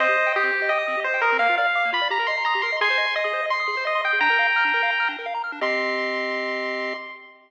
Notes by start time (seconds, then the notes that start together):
0.00 C4 C5 D#5
0.08 G4
0.17 D#5
0.27 G5
0.36 G4 D#6
0.43 C4
0.52 G4
0.62 D#5
0.69 D#5 G5
0.79 D#6
0.88 C4
0.97 G4
1.04 C5 D#5
1.14 G5
1.21 A#4 D#6
1.32 C4
1.39 A#3 F5
1.49 F4
1.58 D5 F5
1.67 F5
1.75 D6
1.85 A#3
1.92 F4 B5
2.02 D5
2.10 G4 A#5
2.19 A#4
2.27 D#5 C6
2.38 A#5
2.45 A#5 D#6
2.55 G4
2.62 A#4 C6
2.72 D#5
2.81 G#4 G#5 C6
2.90 C5
2.98 D#5
3.07 C6
3.16 D#5 D#6
3.25 G#4
3.33 C5
3.43 D#5
3.50 C6
3.60 D#6
3.68 G#4
3.77 C5
3.85 D#5
3.95 C6
4.04 G5 D#6
4.13 G#4
4.21 D4 G5 A#5
4.30 A#4
4.39 F5
4.47 A#5
4.56 F6
4.65 D4
4.74 A#4
4.83 F5
4.91 A#5
5.00 F6
5.09 D4
5.19 A#4
5.26 F5
5.34 A#5
5.44 F6
5.52 D4
5.61 C4 G4 D#5 C6